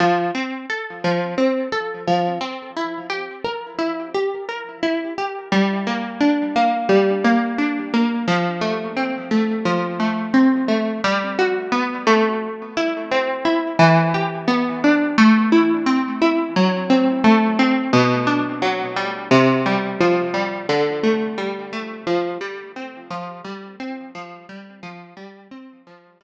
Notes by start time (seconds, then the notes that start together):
0.00 F3
0.34 C4
0.70 A4
1.04 F3
1.38 C4
1.72 A4
2.07 F3
2.41 C4
2.76 E4
3.10 G4
3.44 A#4
3.78 E4
4.14 G4
4.49 A#4
4.83 E4
5.18 G4
5.52 G3
5.87 A#3
6.20 D4
6.56 A#3
6.89 G3
7.24 A#3
7.58 D4
7.93 A#3
8.27 F3
8.61 A3
8.96 C4
9.31 A3
9.65 F3
10.00 A3
10.34 C4
10.68 A3
11.04 G3
11.39 F#4
11.72 B3
12.07 A3
12.77 E4
13.11 C4
13.45 E4
13.79 E3
14.14 G4
14.48 B3
14.84 D4
15.18 A3
15.52 E4
15.86 C4
16.21 E4
16.56 F#3
16.90 C4
17.24 A3
17.59 C4
17.93 B2
18.27 D4
18.62 F#3
18.96 G3
19.31 C3
19.66 G3
20.00 F3
20.34 G3
20.69 D3
21.03 A3
21.38 G3
21.73 A3
22.07 F3
22.41 G3
22.76 C4
23.10 F3
23.44 G3
23.80 C4
24.15 F3
24.49 G3
24.83 F3
25.17 G3
25.51 C4
25.87 F3
26.21 G3